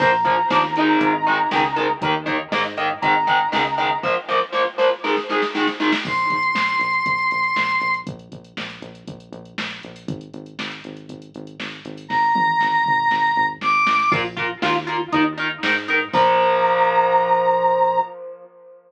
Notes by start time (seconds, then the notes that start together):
0.00 A#1 F3 A#3 A#5, kick, crash
0.25 F3 A#3, kick, closed hi-hat
0.50 D#2 F3 A#3, snare
0.76 D#3 G#3, closed hi-hat
1.01 G#1, kick, closed hi-hat
1.27 D#3 G#3
1.51 C#2 D#3 G#3, snare, closed hi-hat
1.76 D#3 G#3, closed hi-hat
2.01 D#2 D#3 A#3, kick, closed hi-hat
2.26 D#3 A#3, kick, closed hi-hat
2.51 G#2 D#3 A#3, snare
2.77 D#3 A#3, closed hi-hat
3.02 G#1 D#3 G#3 A#5, kick, closed hi-hat
3.27 D#3 G#3, kick, closed hi-hat
3.52 C#2 D#3 G#3, snare
3.78 D#3 G#3, closed hi-hat
4.03 F3 A#3, kick, snare
4.29 F3 A#3, snare
4.53 F3 A#3, snare
4.78 F3 A#3, snare
5.04 D#3 G#3, snare
5.17 snare
5.29 D#3 G#3, snare
5.42 snare
5.55 D#3 G#3, snare
5.67 snare
5.80 D#3 G#3, snare
5.92 snare
6.05 A#1 C6, kick, crash
6.18 closed hi-hat
6.30 A#1, kick, closed hi-hat
6.43 closed hi-hat
6.54 A#1, snare
6.68 closed hi-hat
6.80 A#1, closed hi-hat
6.93 closed hi-hat
7.06 A#1, kick, closed hi-hat
7.18 closed hi-hat
7.31 A#1, closed hi-hat
7.44 closed hi-hat
7.56 A#1, snare
7.69 closed hi-hat
7.81 A#1, closed hi-hat
7.94 closed hi-hat
8.07 A#1, kick, closed hi-hat
8.19 closed hi-hat
8.32 A#1, kick, closed hi-hat
8.45 closed hi-hat
8.57 A#1, snare
8.70 closed hi-hat
8.82 A#1, closed hi-hat
8.95 closed hi-hat
9.08 A#1, kick, closed hi-hat
9.20 closed hi-hat
9.32 A#1, closed hi-hat
9.45 closed hi-hat
9.58 A#1, snare
9.71 closed hi-hat
9.83 A#1, closed hi-hat
9.96 open hi-hat
10.08 G#1, kick, closed hi-hat
10.21 closed hi-hat
10.34 G#1, closed hi-hat
10.46 closed hi-hat
10.59 G#1, snare
10.71 closed hi-hat
10.84 G#1, closed hi-hat
10.97 closed hi-hat
11.08 G#1, kick, closed hi-hat
11.22 closed hi-hat
11.34 G#1, closed hi-hat
11.47 closed hi-hat
11.59 G#1, snare
11.72 closed hi-hat
11.85 G#1, closed hi-hat
11.97 open hi-hat
12.09 G#1 A#5, kick, snare
12.35 G#1, high tom
12.61 G#1, snare
12.86 G#1, mid tom
13.11 G#1, snare
13.36 G#1, floor tom
13.61 G#1 D6, snare
13.86 A1, snare
14.11 A#1 F4 A#4, kick, crash
14.37 F4 A#4, kick, closed hi-hat
14.62 D#2 F4 A#4, snare
14.87 F4 A#4, closed hi-hat
15.13 D#2 D#4 A#4, kick, closed hi-hat
15.38 D#4 A#4, closed hi-hat
15.63 G#2 D#4 A#4, snare
15.88 D#4 A#4, closed hi-hat
16.13 A#1 F3 A#3 A#5, kick, crash